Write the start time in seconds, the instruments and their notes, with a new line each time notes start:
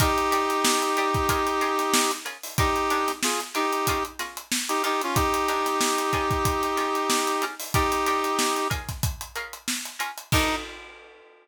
0.00 pizzicato strings D#3 D4 G4 A#4, brass section D#4 G4, kick, closed hi-hat
0.18 closed hi-hat
0.31 pizzicato strings D#3 D4 G4 A#4, closed hi-hat
0.50 closed hi-hat
0.65 snare
0.82 closed hi-hat
0.97 pizzicato strings D#3 D4 G4 A#4, closed hi-hat
1.14 kick, closed hi-hat
1.29 pizzicato strings C#4 F4 G#4 A#4, kick, closed hi-hat
1.47 closed hi-hat
1.61 pizzicato strings C#4 F4 G#4 A#4, closed hi-hat
1.79 snare, closed hi-hat
1.94 snare
2.11 closed hi-hat
2.25 pizzicato strings C#4 F4 G#4 A#4, closed hi-hat
2.43 open hi-hat
2.58 pizzicato strings D#3 D4 G4 A#4, brass section D#4 G4, kick, closed hi-hat
2.76 closed hi-hat
2.90 pizzicato strings D#3 D4 G4 A#4, closed hi-hat
3.08 snare, closed hi-hat
3.23 brass section F4 G#4, snare
3.40 snare, closed hi-hat
3.54 pizzicato strings D#3 D4 G4 A#4, brass section D#4 G4, closed hi-hat
3.72 closed hi-hat
3.87 pizzicato strings C#4 F4 G#4 A#4, kick, closed hi-hat
4.05 closed hi-hat
4.19 pizzicato strings C#4 F4 G#4 A#4, snare, closed hi-hat
4.37 closed hi-hat
4.52 snare
4.69 brass section D#4 G4, closed hi-hat
4.83 pizzicato strings D#3 D4 G4 A#4, brass section D#4 G4, closed hi-hat
5.01 brass section C#4 F4, closed hi-hat
5.15 brass section D#4 G4, kick, closed hi-hat
5.34 closed hi-hat
5.48 pizzicato strings D#3 D4 G4 A#4, closed hi-hat
5.66 snare, closed hi-hat
5.81 snare
5.98 closed hi-hat
6.13 pizzicato strings C#4 F4 G#4 A#4, kick, closed hi-hat
6.31 kick, closed hi-hat
6.45 kick, closed hi-hat
6.63 closed hi-hat
6.77 pizzicato strings C#4 F4 G#4 A#4, snare, closed hi-hat
6.95 closed hi-hat
7.10 snare
7.27 closed hi-hat
7.42 pizzicato strings C#4 F4 G#4 A#4, snare, closed hi-hat
7.60 open hi-hat
7.74 pizzicato strings D#3 D4 G4 A#4, brass section D#4 G4, kick, closed hi-hat
7.92 snare, closed hi-hat
8.06 pizzicato strings D#3 D4 G4 A#4, snare, closed hi-hat
8.24 closed hi-hat
8.39 snare
8.56 closed hi-hat
8.70 pizzicato strings C#4 F4 G#4 A#4, kick, closed hi-hat
8.89 kick, snare, closed hi-hat
9.03 kick, closed hi-hat
9.21 closed hi-hat
9.35 pizzicato strings C#4 F4 G#4 A#4, closed hi-hat
9.53 closed hi-hat
9.68 snare
9.85 closed hi-hat
9.99 pizzicato strings C#4 F4 G#4 A#4, closed hi-hat
10.18 closed hi-hat
10.32 pizzicato strings D#3 D4 G4 A#4, brass section D#4, kick, crash